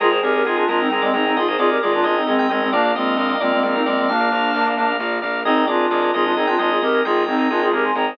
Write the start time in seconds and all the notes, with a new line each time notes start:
0.00 G#1 F4 G#4 A#4 D#5
0.11 G#4 A#4 C5 D#5
0.22 G#1 G4 G#4 A#4 D#5
0.34 G4 A#4
0.45 G#1 F4 G#4 A#4 D#5
0.56 D4 F4 G#4 A#4 D#5
0.68 G#1 D4 F4 G#4 A#4 D#5
0.80 C4 D#4
0.90 G#1 G#3 C4 G#4 A#4 D#5
1.02 G#3 C4 D5
1.13 G#1 C4 D#4 G#4 A#4 D#5
1.26 C4 D#4
1.36 G#1 F4 G#4 D#5
1.48 G#4 A#4 C5 D#5
1.58 G#1 F4 G#4 A#4 D5 D#5
1.70 G4 A#4
1.81 G#1 F4 G#4 A#4 D5 D#5
1.92 D4 F4 G#4 A#4 D#5
2.03 G#1 D4 F4 G#4 A#4 D#5
2.16 C4 D#4
2.27 G#1 G#3 C4 G#4 A#4 D#5
2.38 G#3 C4 G5
2.49 G#1 G#3 C4 G#4 A#4 D#5
2.61 G#3 C4
2.72 A#1 A#3 D4 A#4 D5 F5
2.85 A#4 D5 F5
2.95 A#1 G#3 C4 A#4 D5 D#5 F5
3.17 A#1 A#4 D5 D#5 F5
3.29 A#4 D5 F5
3.40 A#1 G#3 C4 A#4 D5 F5
3.52 G#3 C4
3.63 A#1 G#3 C4 A#4 D5 F5
3.74 C4 D#4 A#4
3.86 A#1 G#3 C4 A#4 D5 F5
3.97 G#3 C4
4.08 A#1 A#3 D4 F5
4.20 A#4 D5 F5
4.32 A#1 A#4 D5 F5
4.54 A#1 A#4 D5 F5
4.66 A#4 D5 F5
4.77 A#1 A#4 D5 F5
5.00 A#1 A#4 D5 F5
5.22 A#1 A#4 D5 F5
5.45 G#1 C4 D#4 G#4 A#4 D#5
5.56 G#4 A#4 D#5
5.66 G#1 D4 F4 G#4 A#4 D5 D#5
5.90 G#1 G#4 A#4 D5 D#5
6.02 G#4 A#4 D#5
6.14 G#1 F4 G#4 A#4 D#5
6.24 D4 F4
6.36 G#1 C4 D#4 G#4 A#4 D#5
6.47 D4 F4 G5
6.58 G#1 D4 F4 G#4 A#4 D#5
6.70 F4 G#4
6.81 G#1 G4 A#4 D#5
6.94 G#4 A#4 D#5
7.05 G#1 F4 G#4 A#4 D#5 G5
7.26 G#1 C4 D#4 G#4 A#4 D#5
7.39 G#4 A#4 D#5
7.50 G#1 D4 F4 G#4 A#4 D#5
7.62 F4 G#4
7.71 G#1 G4 G#4 A#4 D#5
7.84 G#5 C6
7.95 G#1 G#4 A#4 D#5 G5 A#5
8.07 G#4 C5